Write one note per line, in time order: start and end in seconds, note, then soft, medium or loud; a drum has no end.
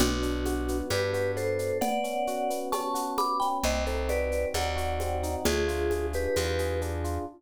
0.00 0.82 B1 medium
0.00 0.69 B3 loud
0.00 0.78 D4 medium
0.00 0.78 F#4 medium
0.00 cowbell medium
0.00 low conga loud
0.00 shaker medium
0.22 0.91 D4 medium
0.22 shaker medium
0.45 1.13 F#4 medium
0.45 high conga medium
0.45 shaker medium
0.68 1.35 B3 medium
0.68 shaker medium
0.90 1.72 G2 medium
0.90 1.58 D4 medium
0.90 1.11 G4 medium
0.90 1.11 B4 medium
0.90 cowbell medium
0.90 high conga medium
0.90 shaker medium
1.13 1.79 F#4 medium
1.13 1.32 G4 medium
1.13 1.32 B4 medium
1.13 shaker medium
1.36 1.79 B3 medium
1.36 1.78 A4 medium
1.36 1.78 C5 medium
1.36 shaker medium
1.59 1.80 D4 medium
1.59 shaker medium
1.81 2.50 B3 loud
1.81 2.60 D5 medium
1.81 2.60 F#5 loud
1.81 cowbell medium
1.81 low conga loud
1.81 shaker medium
2.04 2.72 C#4 medium
2.04 shaker medium
2.27 2.94 F#4 medium
2.27 shaker medium
2.50 3.17 B3 medium
2.50 shaker medium
2.72 3.41 C#4 medium
2.72 3.11 A5 medium
2.72 3.11 C#6 medium
2.72 cowbell medium
2.72 high conga medium
2.72 shaker medium
2.94 3.59 F#4 medium
2.94 shaker medium
3.18 3.61 B3 medium
3.18 3.38 B5 medium
3.18 3.38 D6 medium
3.18 high conga medium
3.18 shaker medium
3.40 3.63 C#4 medium
3.40 3.58 G5 medium
3.40 3.58 B5 medium
3.40 shaker medium
3.64 4.45 C2 medium
3.64 4.30 C4 loud
3.64 3.84 C5 medium
3.64 3.84 D#5 medium
3.64 cowbell medium
3.64 low conga medium
3.64 shaker medium
3.86 4.54 D#4 medium
3.86 4.09 A4 medium
3.86 4.09 C5 medium
3.86 shaker medium
4.08 4.76 F#4 medium
4.08 4.48 B4 medium
4.08 4.48 D5 medium
4.08 high conga medium
4.08 shaker medium
4.31 5.00 C4 medium
4.31 shaker medium
4.54 5.36 D#2 medium
4.54 5.22 D#4 medium
4.54 5.35 D5 medium
4.54 5.35 F#5 medium
4.54 cowbell medium
4.54 high conga medium
4.54 shaker medium
4.76 5.41 F#4 loud
4.76 shaker medium
5.00 5.44 C4 medium
5.00 high conga medium
5.00 shaker medium
5.23 5.45 D#4 medium
5.23 shaker medium
5.45 6.27 D2 medium
5.45 6.14 D4 loud
5.45 6.06 F4 medium
5.45 6.06 G#4 loud
5.45 cowbell medium
5.45 low conga medium
5.45 shaker medium
5.68 6.36 F4 medium
5.68 shaker medium
5.90 6.59 G#4 medium
5.90 high conga medium
5.90 shaker medium
6.13 6.81 D4 medium
6.13 6.80 G4 medium
6.13 6.80 B4 medium
6.13 shaker medium
6.36 7.18 E2 medium
6.36 7.04 F4 medium
6.36 cowbell medium
6.36 high conga medium
6.36 shaker medium
6.59 7.24 G#4 medium
6.59 shaker medium
6.81 7.25 D4 medium
6.81 shaker medium
7.04 7.26 F4 medium
7.04 shaker medium